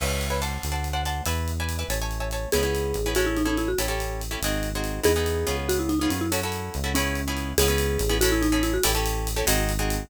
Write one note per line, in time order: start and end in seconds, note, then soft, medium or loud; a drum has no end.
0.00 0.59 C#2 loud
0.00 0.27 B4 medium
0.00 0.27 C#5 medium
0.00 0.27 E5 medium
0.00 0.27 G#5 medium
0.00 crash loud
0.21 closed hi-hat medium
0.30 0.40 B4 medium
0.30 0.40 C#5 medium
0.30 0.40 E5 medium
0.30 0.40 G#5 medium
0.42 0.71 C5 medium
0.42 0.71 D5 medium
0.42 0.71 F#5 medium
0.42 0.71 A5 medium
0.42 closed hi-hat medium
0.63 1.21 D2 medium
0.63 closed hi-hat medium
0.72 0.89 C5 medium
0.72 0.89 D5 medium
0.72 0.89 F#5 medium
0.72 0.89 A5 medium
0.84 closed hi-hat medium
0.93 1.02 C5 medium
0.93 1.02 D5 medium
0.93 1.02 F#5 medium
0.93 1.02 A5 medium
1.05 1.23 C5 medium
1.05 1.23 D5 medium
1.05 1.23 F#5 medium
1.05 1.23 A5 medium
1.05 closed hi-hat medium
1.26 1.84 E2 loud
1.26 1.51 B4 medium
1.26 1.51 D5 medium
1.26 1.51 E5 medium
1.26 1.51 G#5 medium
1.26 closed hi-hat medium
1.48 closed hi-hat medium
1.60 1.77 B4 medium
1.60 1.77 D5 medium
1.60 1.77 E5 medium
1.60 1.77 G#5 medium
1.69 closed hi-hat medium
1.79 1.87 B4 medium
1.79 1.87 D5 medium
1.79 1.87 E5 medium
1.79 1.87 G#5 medium
1.89 2.47 A1 loud
1.89 1.98 C#5 medium
1.89 1.98 E5 medium
1.89 1.98 G#5 medium
1.89 1.98 A5 medium
1.89 closed hi-hat medium
2.02 2.18 C#5 medium
2.02 2.18 E5 medium
2.02 2.18 G#5 medium
2.02 2.18 A5 medium
2.11 closed hi-hat medium
2.20 2.29 C#5 medium
2.20 2.29 E5 medium
2.20 2.29 G#5 medium
2.20 2.29 A5 medium
2.31 2.49 C#5 medium
2.31 2.49 E5 medium
2.31 2.49 G#5 medium
2.31 2.49 A5 medium
2.31 closed hi-hat medium
2.52 2.94 C#2 medium
2.52 2.62 B3 medium
2.52 2.62 C#4 medium
2.52 2.62 E4 medium
2.52 3.09 G#4 medium
2.52 2.62 G#4 medium
2.52 closed hi-hat loud
2.63 2.96 B3 medium
2.63 2.96 C#4 medium
2.63 2.96 E4 medium
2.63 2.96 G#4 medium
2.75 closed hi-hat medium
2.94 3.74 A1 medium
2.94 closed hi-hat medium
3.06 3.14 B3 medium
3.06 3.14 C#4 medium
3.06 3.14 E4 medium
3.06 3.14 G#4 medium
3.15 3.41 C#4 medium
3.15 3.41 E4 medium
3.15 3.26 F#4 medium
3.15 3.41 G#4 medium
3.15 3.41 A4 medium
3.15 closed hi-hat medium
3.26 3.36 E4 medium
3.37 3.47 D#4 medium
3.37 closed hi-hat medium
3.45 3.71 C#4 medium
3.45 3.57 D#4 medium
3.45 3.71 E4 medium
3.45 3.71 G#4 medium
3.45 3.71 A4 medium
3.57 3.68 E4 medium
3.57 closed hi-hat medium
3.68 3.78 F#4 medium
3.78 4.37 A1 medium
3.78 3.87 C#4 medium
3.78 3.87 E4 medium
3.78 3.87 G4 medium
3.78 3.87 A4 medium
3.78 closed hi-hat loud
3.88 4.22 C#4 medium
3.88 4.22 E4 medium
3.88 4.22 G4 medium
3.88 4.22 A4 medium
4.00 closed hi-hat medium
4.21 closed hi-hat medium
4.31 4.39 C#4 medium
4.31 4.39 E4 medium
4.31 4.39 G4 medium
4.31 4.39 A4 medium
4.42 5.00 G#1 medium
4.42 4.69 C4 medium
4.42 4.69 D#4 medium
4.42 4.69 F#4 medium
4.42 4.69 G#4 medium
4.42 closed hi-hat loud
4.63 closed hi-hat medium
4.75 5.00 C4 medium
4.75 5.00 D#4 medium
4.75 5.00 F#4 medium
4.75 5.00 G#4 medium
4.84 closed hi-hat medium
5.03 5.45 E2 medium
5.03 5.12 B3 medium
5.03 5.12 D#4 medium
5.03 5.12 E4 medium
5.03 5.12 G#4 medium
5.03 5.56 G#4 loud
5.03 closed hi-hat loud
5.16 5.46 B3 medium
5.16 5.46 D#4 medium
5.16 5.46 E4 medium
5.16 5.46 G#4 medium
5.26 closed hi-hat medium
5.47 6.08 C#2 medium
5.47 5.93 B3 medium
5.47 5.93 C#4 medium
5.47 5.93 F4 medium
5.47 5.93 G#4 medium
5.47 closed hi-hat medium
5.69 5.79 F#4 medium
5.69 closed hi-hat loud
5.79 5.89 E4 medium
5.89 5.99 D#4 medium
5.89 closed hi-hat medium
5.99 6.27 B3 medium
5.99 6.27 C#4 medium
5.99 6.09 D#4 medium
5.99 6.27 F4 medium
5.99 6.27 G#4 medium
6.10 6.70 F#2 medium
6.10 6.21 C#4 medium
6.10 closed hi-hat medium
6.21 6.31 E4 medium
6.32 6.40 C#4 medium
6.32 6.40 E4 medium
6.32 6.40 F#4 medium
6.32 6.40 A4 medium
6.32 closed hi-hat loud
6.43 6.77 C#4 medium
6.43 6.77 E4 medium
6.43 6.77 F#4 medium
6.43 6.77 A4 medium
6.52 closed hi-hat medium
6.74 7.54 C#2 loud
6.74 closed hi-hat medium
6.84 6.92 C#4 medium
6.84 6.92 E4 medium
6.84 6.92 F#4 medium
6.84 6.92 A4 medium
6.95 7.21 B3 medium
6.95 7.50 C#4 medium
6.95 7.21 C#4 medium
6.95 7.21 E4 medium
6.95 7.21 G#4 medium
6.95 closed hi-hat loud
7.15 closed hi-hat medium
7.28 7.53 B3 medium
7.28 7.53 C#4 medium
7.28 7.53 E4 medium
7.28 7.53 G#4 medium
7.37 closed hi-hat medium
7.58 7.98 C#2 loud
7.58 7.67 B3 loud
7.58 7.67 C#4 medium
7.58 7.67 E4 medium
7.58 8.15 G#4 loud
7.58 7.67 G#4 medium
7.58 closed hi-hat loud
7.68 8.02 B3 medium
7.68 8.02 C#4 medium
7.68 8.02 E4 medium
7.68 8.02 G#4 medium
7.78 closed hi-hat medium
7.99 8.79 A1 loud
7.99 closed hi-hat medium
8.09 8.18 B3 medium
8.09 8.18 C#4 medium
8.09 8.18 E4 medium
8.09 8.18 G#4 medium
8.21 8.47 C#4 loud
8.21 8.47 E4 medium
8.21 8.31 F#4 loud
8.21 8.47 G#4 medium
8.21 8.47 A4 loud
8.21 closed hi-hat loud
8.32 8.42 E4 loud
8.42 8.52 D#4 loud
8.42 closed hi-hat medium
8.52 8.77 C#4 medium
8.52 8.62 D#4 medium
8.52 8.77 E4 medium
8.52 8.77 G#4 medium
8.52 8.77 A4 medium
8.63 8.73 E4 loud
8.63 closed hi-hat medium
8.74 8.84 F#4 loud
8.83 9.43 A1 loud
8.83 8.92 C#4 medium
8.83 8.92 E4 medium
8.83 8.92 G4 medium
8.83 8.92 A4 loud
8.83 closed hi-hat loud
8.95 9.28 C#4 medium
8.95 9.28 E4 medium
8.95 9.28 G4 medium
8.95 9.28 A4 medium
9.06 closed hi-hat medium
9.27 closed hi-hat medium
9.36 9.45 C#4 medium
9.36 9.45 E4 medium
9.36 9.45 G4 medium
9.36 9.45 A4 medium
9.47 10.05 G#1 loud
9.47 9.72 C4 medium
9.47 9.72 D#4 loud
9.47 9.72 F#4 medium
9.47 9.72 G#4 medium
9.47 closed hi-hat loud
9.69 closed hi-hat medium
9.79 10.04 C4 medium
9.79 10.04 D#4 medium
9.79 10.04 F#4 medium
9.79 10.04 G#4 medium
9.90 closed hi-hat medium